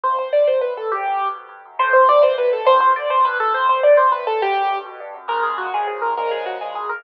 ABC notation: X:1
M:6/8
L:1/8
Q:3/8=137
K:Am
V:1 name="Acoustic Grand Piano"
c c d c B A | G3 z3 | c c d c B A | c c d c B A |
c c d c B A | G3 z3 | [K:Bbm] B A G A A B | B A G A A B |]
V:2 name="Acoustic Grand Piano" clef=bass
F,, G,, A,, C, A,, G,, | E,, ^F,, G,, B,, G,, F,, | A,, B,, C, E, C, B,, | G,, B,, D, B,, G,, B,, |
F,, G,, A,, C, A,, G,, | E,, ^F,, G,, B,, G,, F,, | [K:Bbm] [B,,D,F,A,]3 [B,,D,F,A,]3 | [B,,D,F,A,]3 [B,,D,F,A,]3 |]